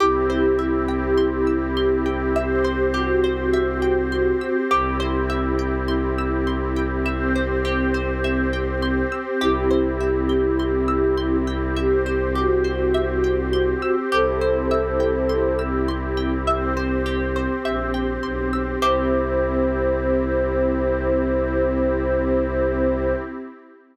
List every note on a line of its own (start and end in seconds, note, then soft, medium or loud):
0.00 4.33 C2 medium
0.00 2.33 C4 loud
0.00 2.07 E4 medium
0.00 2.33 E4 loud
0.00 2.07 G4 medium
0.00 0.27 G4 medium
0.00 2.33 G4 loud
0.30 0.56 C5 medium
0.59 0.85 E5 medium
0.88 1.15 G5 medium
1.17 1.44 C6 medium
1.47 1.74 E6 medium
1.77 2.03 C6 medium
2.06 2.32 G5 medium
2.36 4.69 C4 loud
2.36 4.69 G4 medium
2.36 2.85 G4 medium
2.36 4.69 C5 loud
2.36 2.62 E5 medium
2.64 2.91 C5 medium
2.94 4.56 F#4 medium
2.94 3.20 G4 medium
3.24 3.50 C5 medium
3.53 3.80 E5 loud
3.82 4.09 G5 medium
4.12 4.38 C6 medium
4.41 4.68 E6 medium
4.71 9.04 C2 loud
4.71 7.04 C4 medium
4.71 7.04 E4 medium
4.71 4.97 G4 loud
4.71 7.04 G4 loud
5.00 5.26 C5 medium
5.30 5.56 E5 medium
5.59 5.85 G5 medium
5.88 6.14 C6 medium
6.18 6.45 E6 medium
6.47 6.73 C6 medium
6.76 7.03 G5 medium
7.05 9.39 C4 loud
7.05 9.39 G4 loud
7.05 9.39 C5 loud
7.05 7.32 E5 medium
7.36 7.62 C5 medium
7.65 7.91 G4 medium
7.94 8.21 C5 medium
8.24 8.50 E5 medium
8.53 8.79 G5 medium
8.82 9.09 C6 medium
9.12 9.38 E6 medium
9.41 13.74 C2 loud
9.41 11.74 C4 loud
9.41 11.36 E4 medium
9.41 11.74 E4 loud
9.41 9.67 G4 loud
9.41 11.36 G4 medium
9.41 11.74 G4 medium
9.71 9.97 C5 medium
10.00 10.27 E5 medium
10.29 10.56 G5 medium
10.59 10.86 C6 medium
10.88 11.14 E6 medium
11.17 11.44 C6 medium
11.47 11.74 G5 medium
11.76 14.11 C4 medium
11.76 12.30 G4 medium
11.76 14.11 G4 loud
11.76 14.11 C5 medium
11.76 12.03 E5 medium
12.06 12.32 C5 medium
12.35 13.95 F#4 medium
12.35 12.62 G4 medium
12.64 12.91 C5 medium
12.94 13.21 E5 medium
13.24 13.50 G5 medium
13.53 13.79 C6 medium
13.82 14.09 E6 medium
14.12 17.47 C2 loud
14.12 16.45 C4 medium
14.12 16.45 E4 medium
14.12 16.45 G4 medium
14.12 14.38 G4 loud
14.12 15.60 A4 medium
14.12 15.60 C5 medium
14.41 14.68 C5 medium
14.71 14.97 E5 medium
15.00 15.26 G5 medium
15.29 15.56 C6 medium
15.59 15.85 E6 medium
15.88 16.15 C6 medium
16.17 16.44 G5 medium
16.46 18.79 C4 loud
16.46 18.79 G4 medium
16.46 18.79 C5 loud
16.46 16.74 E5 medium
16.77 17.03 C5 medium
17.06 17.32 G4 medium
17.36 17.62 C5 medium
17.65 18.18 A#1 medium
17.65 17.91 E5 medium
17.94 18.20 G5 medium
18.23 18.76 B1 medium
18.23 18.50 C6 medium
18.53 18.79 E6 medium
18.82 23.14 C2 loud
18.82 23.13 C4 loud
18.82 23.13 E4 loud
18.82 23.13 G4 medium
18.82 23.13 G4 loud
18.82 23.13 C5 loud
18.82 23.13 E5 loud